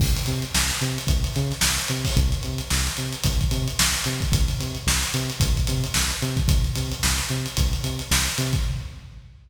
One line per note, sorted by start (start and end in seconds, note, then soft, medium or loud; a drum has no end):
0.00 0.18 C2 medium
0.00 kick loud
0.00 crash medium
0.17 closed hi-hat medium
0.26 0.44 C3 medium
0.26 closed hi-hat medium
0.42 closed hi-hat medium
0.54 0.71 C2 medium
0.54 snare loud
0.70 snare medium
0.70 closed hi-hat medium
0.81 0.98 C3 medium
0.81 closed hi-hat medium
0.98 closed hi-hat medium
1.07 1.25 C2 medium
1.07 kick medium
1.07 closed hi-hat medium
1.24 closed hi-hat medium
1.34 1.53 C#3 medium
1.34 snare soft
1.34 closed hi-hat medium
1.51 snare soft
1.51 closed hi-hat medium
1.61 1.79 C2 medium
1.61 snare loud
1.78 closed hi-hat medium
1.88 2.06 C3 medium
1.88 closed hi-hat medium
2.05 kick medium
2.05 open hi-hat medium
2.17 2.34 C2 loud
2.17 kick medium
2.17 closed hi-hat medium
2.32 closed hi-hat medium
2.43 2.61 C3 medium
2.43 closed hi-hat medium
2.58 closed hi-hat medium
2.70 2.88 C2 medium
2.70 snare medium
2.86 snare medium
2.86 closed hi-hat medium
2.97 3.15 C3 medium
2.97 closed hi-hat medium
3.13 closed hi-hat medium
3.24 3.42 C2 medium
3.24 kick medium
3.24 closed hi-hat loud
3.41 kick medium
3.41 closed hi-hat medium
3.51 3.68 C3 medium
3.51 closed hi-hat medium
3.68 closed hi-hat medium
3.79 3.96 C2 medium
3.79 snare loud
3.94 closed hi-hat medium
4.04 4.22 C3 medium
4.04 closed hi-hat medium
4.20 kick medium
4.20 closed hi-hat medium
4.32 4.50 C2 loud
4.32 kick loud
4.32 closed hi-hat loud
4.48 closed hi-hat medium
4.60 4.77 C3 medium
4.60 closed hi-hat medium
4.75 closed hi-hat medium
4.86 5.03 C2 medium
4.86 snare loud
5.02 snare medium
5.02 closed hi-hat medium
5.14 5.31 C3 medium
5.14 snare soft
5.14 closed hi-hat medium
5.30 closed hi-hat medium
5.40 5.58 C2 medium
5.40 kick loud
5.40 closed hi-hat loud
5.57 kick medium
5.57 closed hi-hat medium
5.67 5.85 C3 medium
5.67 closed hi-hat medium
5.84 closed hi-hat medium
5.94 6.12 C2 medium
5.94 snare loud
6.11 closed hi-hat medium
6.22 6.39 C3 medium
6.22 closed hi-hat medium
6.37 kick medium
6.37 closed hi-hat medium
6.48 6.66 C2 medium
6.48 kick loud
6.48 closed hi-hat loud
6.64 closed hi-hat medium
6.76 6.93 C3 medium
6.76 closed hi-hat medium
6.92 closed hi-hat medium
7.03 7.20 C2 medium
7.03 snare loud
7.18 snare medium
7.18 closed hi-hat medium
7.29 7.47 C3 medium
7.29 closed hi-hat medium
7.46 closed hi-hat medium
7.57 7.74 C2 medium
7.57 kick medium
7.57 closed hi-hat loud
7.73 closed hi-hat medium
7.84 8.01 C3 medium
7.84 closed hi-hat medium
7.99 snare soft
7.99 closed hi-hat medium
8.11 8.28 C2 medium
8.11 snare loud
8.26 closed hi-hat medium
8.38 8.55 C3 loud
8.38 closed hi-hat medium
8.53 kick medium
8.53 closed hi-hat medium